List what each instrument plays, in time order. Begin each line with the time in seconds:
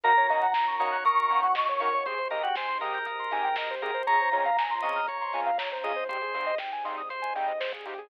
0.04 synth bass 2 D#2, string ensemble 1 A#3 C#4 D#4 F#4, lead 2 (sawtooth) A#3 C#4 D#4 F#4, lead 1 (square) A#4, drawbar organ A#4, electric piano 2 A#5, closed hi-hat
0.17 lead 1 (square) C#5, closed hi-hat
0.29 synth bass 2 D#3, lead 2 (sawtooth) A#3 C#4 D#4 F#4, lead 1 (square) D#5, open hi-hat
0.42 lead 1 (square) F#5, closed hi-hat
0.54 synth bass 2 D#2, lead 1 (square) A#5, kick, snare
0.67 lead 1 (square) C#6, closed hi-hat
0.80 synth bass 2 D#3, lead 2 (sawtooth) A#3 C#4 D#4 F#4, drawbar organ C#5, lead 1 (square) D#6, open hi-hat
0.92 lead 1 (square) F#6, closed hi-hat
1.04 synth bass 2 D#2, drawbar organ A#4, electric piano 2 C#6, lead 1 (square) D#6, kick, closed hi-hat
1.17 lead 1 (square) C#6, closed hi-hat
1.30 synth bass 2 D#3, lead 2 (sawtooth) A#3 C#4 D#4 F#4, lead 1 (square) A#5, open hi-hat
1.43 lead 1 (square) F#5, closed hi-hat
1.55 synth bass 2 D#2, lead 1 (square) D#5, kick, snare
1.67 lead 1 (square) C#5, closed hi-hat
1.80 synth bass 2 D#3, lead 2 (sawtooth) A#3 C#4 D#4 F#4, lead 1 (square) A#4, drawbar organ C#5, open hi-hat
1.92 lead 1 (square) C#5, closed hi-hat
2.06 synth bass 2 G#1, string ensemble 1 G#3 C4 D#4 G4, lead 2 (sawtooth) G#3 C4 D#4 G4, lead 1 (square) G#4, drawbar organ C5, kick, closed hi-hat
2.18 lead 1 (square) C5, closed hi-hat
2.31 synth bass 2 G#2, lead 2 (sawtooth) G#3 C4 D#4 G4, drawbar organ A#4, lead 1 (square) D#5, open hi-hat
2.43 drawbar organ F#4, lead 1 (square) G5, closed hi-hat
2.55 synth bass 2 G#1, drawbar organ C5, lead 1 (square) G#5, kick, snare
2.68 lead 1 (square) C6, closed hi-hat
2.81 synth bass 2 G#2, lead 2 (sawtooth) G#3 C4 D#4 G4, drawbar organ A#4, lead 1 (square) D#6, open hi-hat
2.94 lead 1 (square) G6, closed hi-hat
3.06 synth bass 2 G#1, lead 1 (square) D#6, kick, closed hi-hat
3.19 lead 1 (square) C6, closed hi-hat
3.31 synth bass 2 G#2, lead 2 (sawtooth) G#3 C4 D#4 G4, lead 1 (square) G#5, open hi-hat
3.44 lead 1 (square) G5, closed hi-hat
3.56 synth bass 2 G#1, lead 1 (square) D#5, kick, snare
3.70 lead 1 (square) C5, closed hi-hat
3.82 synth bass 2 G#2, lead 2 (sawtooth) G#3 C4 D#4 G4, lead 1 (square) G#4, drawbar organ A#4, open hi-hat
3.94 lead 1 (square) C5, closed hi-hat
4.07 synth bass 2 C#2, string ensemble 1 G#3 C4 C#4 F4, lead 2 (sawtooth) G#3 C4 C#4 F4, lead 1 (square) G#4, drawbar organ C#5, electric piano 2 A#5, kick, closed hi-hat
4.20 lead 1 (square) C5, closed hi-hat
4.32 synth bass 2 C#3, lead 2 (sawtooth) G#3 C4 C#4 F4, lead 1 (square) C#5, open hi-hat
4.45 lead 1 (square) F5, closed hi-hat
4.57 synth bass 2 C#2, lead 1 (square) G#5, kick, snare
4.70 lead 1 (square) C6, closed hi-hat
4.82 synth bass 2 C#3, lead 2 (sawtooth) G#3 C4 C#4 F4, drawbar organ D#5, lead 1 (square) C#6, open hi-hat
4.96 lead 1 (square) F6, closed hi-hat
5.07 synth bass 2 C#2, drawbar organ C#5, lead 1 (square) C#6, kick, closed hi-hat
5.21 lead 1 (square) C6, closed hi-hat
5.33 synth bass 2 C#3, lead 2 (sawtooth) G#3 C4 C#4 F4, lead 1 (square) G#5, open hi-hat
5.46 lead 1 (square) F5, closed hi-hat
5.58 synth bass 2 C#2, lead 1 (square) C#5, kick, snare
5.72 lead 1 (square) C5, closed hi-hat
5.84 synth bass 2 C#3, lead 2 (sawtooth) G#3 C4 C#4 F4, lead 1 (square) G#4, drawbar organ D#5, open hi-hat
5.96 lead 1 (square) C5, closed hi-hat
6.09 synth bass 2 G#1, lead 2 (sawtooth) G3 G#3 C4 D#4, string ensemble 1 G3 G#3 C4 D#4, lead 1 (square) G4, drawbar organ C5, kick, closed hi-hat
6.21 lead 1 (square) G#4, closed hi-hat
6.34 synth bass 2 G#2, lead 2 (sawtooth) G3 G#3 C4 D#4, lead 1 (square) C5, open hi-hat
6.46 lead 1 (square) D#5, closed hi-hat
6.58 synth bass 2 G#1, lead 1 (square) G5, kick, snare
6.72 lead 1 (square) G#5, closed hi-hat
6.85 synth bass 2 G#2, lead 2 (sawtooth) G3 G#3 C4 D#4, lead 1 (square) C6, open hi-hat
6.97 lead 1 (square) D#6, closed hi-hat
7.09 synth bass 2 G#1, drawbar organ C5, lead 1 (square) C6, kick, closed hi-hat
7.22 lead 1 (square) G#5, closed hi-hat
7.35 synth bass 2 G#2, lead 2 (sawtooth) G3 G#3 C4 D#4, lead 1 (square) G5, open hi-hat
7.47 lead 1 (square) D#5, closed hi-hat
7.60 synth bass 2 G#1, lead 1 (square) C5, snare
7.73 lead 1 (square) G#4, kick, closed hi-hat
7.85 synth bass 2 G#2, lead 2 (sawtooth) G3 G#3 C4 D#4, lead 1 (square) G4, open hi-hat
7.98 lead 1 (square) G#4, closed hi-hat